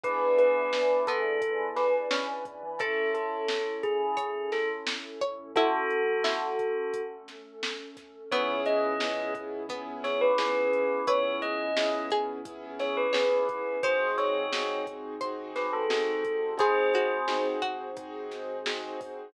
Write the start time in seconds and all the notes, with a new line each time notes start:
0.04 E2 B3 D4 E4 G#4 B4 D5 E5 G#5, kick, closed hi-hat
0.39 B4, closed hi-hat
0.73 snare
1.07 E2 B3 A4, kick, closed hi-hat
1.25 E2
1.42 B4 D5 G#5 B5, kick, closed hi-hat
1.59 E2
1.76 B4, snare, closed hi-hat
2.11 C#4, snare
2.45 E2, kick, closed hi-hat
2.63 E3
2.78 A1 C#4 E4 A4 C#5 E5 A5, kick, closed hi-hat
3.14 A4, closed hi-hat
3.48 snare
3.83 A1 G#4, kick, closed hi-hat
4.01 A1
4.17 C#5, kick, closed hi-hat
4.35 A1
4.52 A4, snare, closed hi-hat
4.87 snare
5.21 A1 C#5, kick, closed hi-hat
5.39 A1
5.55 A3 C#4 E4 F#4 A4, kick, closed hi-hat
5.91 closed hi-hat
6.24 E4, snare
6.59 kick, closed hi-hat
6.94 kick, closed hi-hat
7.28 snare, closed hi-hat
7.63 snare
7.97 kick, snare, closed hi-hat
8.32 C#2 B3 C#4 E4 G#4 C#5, kick, closed hi-hat
8.66 D#5, closed hi-hat
9.00 B3 C#4 E4 G#4, snare
9.35 kick, closed hi-hat
9.69 B3 C#4 E4 G#4, kick, closed hi-hat
10.04 C#5, snare, closed hi-hat
10.21 B4
10.38 B3 C#4 E4 G#4, snare
10.73 closed hi-hat
11.07 C#2 B3 C#4 E4 G#4 B4 C#5, kick, closed hi-hat
11.42 D#5, closed hi-hat
11.77 B3 C#4 E4 G#4, snare
12.10 G#4, kick, closed hi-hat
12.45 B3 C#4 E4 G#4, kick, closed hi-hat
12.79 C#5, snare, closed hi-hat
12.97 B4
13.13 B3 C#4 E4 G#4 C#5, snare
13.49 kick, closed hi-hat
13.83 G#1 C4 D#4 F#4 G#4 C5, kick, closed hi-hat
14.18 C#5, snare, closed hi-hat
14.53 C4 D#4 F#4 G#4, snare
14.87 kick, closed hi-hat
15.21 C4 D#4 F#4 G#4 C5, kick, closed hi-hat
15.56 B4, snare, closed hi-hat
15.73 A4
15.90 C4 D#4 F#4 G#4, snare
16.25 kick, closed hi-hat
16.57 C4 D#4 F#4 G#4 C5, kick, closed hi-hat
16.94 F#4, closed hi-hat
17.28 C4 D#4 F#4 G#4, snare
17.62 F#4, kick, closed hi-hat
17.97 C4 D#4 F#4 G#4, kick, closed hi-hat
18.31 snare, closed hi-hat
18.66 C4 D#4 F#4 G#4, snare
19.01 kick, open hi-hat